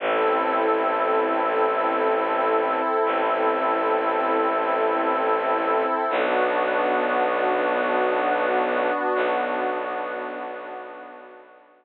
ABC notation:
X:1
M:3/4
L:1/8
Q:1/4=59
K:Bphr
V:1 name="Pad 5 (bowed)"
[CEA]6- | [CEA]6 | [B,DF]6- | [B,DF]6 |]
V:2 name="Violin" clef=bass
A,,,6 | A,,,6 | B,,,6 | B,,,6 |]